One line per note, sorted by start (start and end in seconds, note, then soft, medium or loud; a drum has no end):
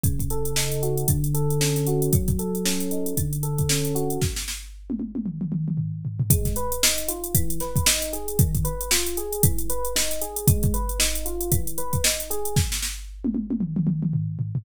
0.04 1.04 C#3 medium
0.04 kick medium
0.04 closed hi-hat medium
0.19 kick medium
0.19 closed hi-hat medium
0.30 1.06 A4 medium
0.30 closed hi-hat medium
0.45 closed hi-hat medium
0.56 1.07 D#4 medium
0.56 snare medium
0.72 closed hi-hat medium
0.82 1.07 F#4 medium
0.82 closed hi-hat medium
0.97 closed hi-hat medium
1.08 2.09 D3 medium
1.08 kick medium
1.08 closed hi-hat medium
1.24 closed hi-hat medium
1.34 2.09 A4 medium
1.34 closed hi-hat medium
1.50 closed hi-hat medium
1.61 2.11 C#4 medium
1.61 snare medium
1.76 snare soft
1.76 closed hi-hat medium
1.87 2.12 F#4 medium
1.87 closed hi-hat medium
2.02 closed hi-hat medium
2.13 3.13 F#3 medium
2.13 kick medium
2.13 closed hi-hat medium
2.28 kick medium
2.28 closed hi-hat medium
2.39 3.14 A4 medium
2.39 closed hi-hat medium
2.55 closed hi-hat medium
2.65 3.15 C#4 medium
2.65 snare medium
2.80 closed hi-hat medium
2.91 3.16 D#4 medium
2.91 closed hi-hat medium
3.06 closed hi-hat medium
3.17 4.18 D3 medium
3.17 kick medium
3.17 closed hi-hat medium
3.33 closed hi-hat medium
3.43 4.18 A4 medium
3.43 closed hi-hat medium
3.58 kick medium
3.58 closed hi-hat medium
3.69 4.20 C#4 medium
3.69 snare medium
3.85 closed hi-hat medium
3.95 4.20 F#4 medium
3.95 closed hi-hat medium
4.10 closed hi-hat medium
4.22 kick medium
4.22 snare medium
4.36 snare medium
4.48 snare medium
4.90 high tom medium
5.00 high tom medium
5.15 high tom medium
5.26 mid tom medium
5.41 mid tom medium
5.52 mid tom medium
5.68 mid tom medium
5.77 floor tom medium
6.05 floor tom medium
6.20 floor tom medium
6.30 6.57 G#3 medium
6.30 kick loud
6.30 closed hi-hat loud
6.45 kick medium
6.45 snare soft
6.45 closed hi-hat medium
6.56 6.83 B4 medium
6.56 closed hi-hat medium
6.72 closed hi-hat medium
6.83 7.09 D#4 medium
6.83 snare loud
6.98 closed hi-hat medium
7.08 7.33 F4 medium
7.08 closed hi-hat medium
7.24 closed hi-hat medium
7.35 7.61 E3 medium
7.35 kick medium
7.35 closed hi-hat loud
7.50 closed hi-hat medium
7.60 7.87 B4 medium
7.60 snare soft
7.60 closed hi-hat medium
7.76 kick medium
7.76 closed hi-hat medium
7.86 8.13 D#4 medium
7.86 snare loud
8.02 snare soft
8.02 closed hi-hat medium
8.13 8.38 G#4 medium
8.13 closed hi-hat medium
8.28 closed hi-hat medium
8.39 8.66 D#3 medium
8.39 kick loud
8.39 closed hi-hat medium
8.55 kick medium
8.55 closed hi-hat medium
8.65 8.91 B4 medium
8.65 closed hi-hat medium
8.81 closed hi-hat medium
8.91 9.17 F4 medium
8.91 snare loud
9.07 closed hi-hat medium
9.17 9.42 G#4 medium
9.17 closed hi-hat medium
9.33 closed hi-hat medium
9.43 9.70 E3 medium
9.43 kick medium
9.43 closed hi-hat loud
9.58 closed hi-hat medium
9.70 9.96 B4 medium
9.70 closed hi-hat medium
9.85 closed hi-hat medium
9.96 10.22 D#4 medium
9.96 snare medium
10.11 snare soft
10.11 closed hi-hat medium
10.22 10.47 G#4 medium
10.22 closed hi-hat medium
10.36 closed hi-hat medium
10.47 10.74 G#3 medium
10.47 kick loud
10.47 closed hi-hat loud
10.63 kick medium
10.63 closed hi-hat medium
10.74 11.00 B4 medium
10.74 closed hi-hat medium
10.89 closed hi-hat medium
10.99 11.25 D#4 medium
10.99 snare medium
11.15 closed hi-hat medium
11.26 11.51 F4 medium
11.26 closed hi-hat medium
11.41 closed hi-hat medium
11.52 11.78 E3 medium
11.52 kick medium
11.52 closed hi-hat medium
11.67 closed hi-hat medium
11.78 12.04 B4 medium
11.78 closed hi-hat medium
11.93 kick medium
11.93 closed hi-hat medium
12.04 12.30 D#4 medium
12.04 snare loud
12.20 closed hi-hat medium
12.30 12.55 G#4 medium
12.30 closed hi-hat medium
12.45 closed hi-hat medium
12.56 kick medium
12.56 snare medium
12.72 snare medium
12.82 snare medium
13.25 high tom medium
13.35 high tom medium
13.51 high tom medium
13.61 mid tom medium
13.76 mid tom medium
13.87 mid tom medium
14.03 mid tom medium
14.13 floor tom medium
14.39 floor tom medium
14.55 floor tom loud